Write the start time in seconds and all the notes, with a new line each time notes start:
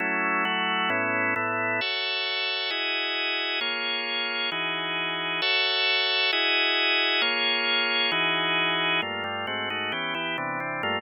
0.00 F#3 A3 C#4 E4
0.45 F#3 A3 E4 F#4
0.90 A2 B3 C#4 E4
1.36 A2 A3 B3 E4
1.81 F#4 A4 C#5 E5
2.70 E4 F#4 G#4 D#5
3.61 A#3 F4 G#4 C#5
4.52 E3 D#4 F#4 G#4
5.42 F#4 A4 C#5 E5
6.33 E4 F#4 G#4 D#5
7.22 A#3 F4 G#4 C#5
8.12 E3 D#4 F#4 G#4
9.02 G2 A3 A#3 F4
9.24 G2 G3 A3 F4
9.47 G#2 A3 C4 F#4
9.70 G#2 A3 D#4 F#4
9.92 E3 B3 C#4 G4
10.14 E3 B3 E4 G4
10.38 C3 E3 B3 D4
10.60 C3 E3 C4 D4
10.83 G2 A3 A#3 F4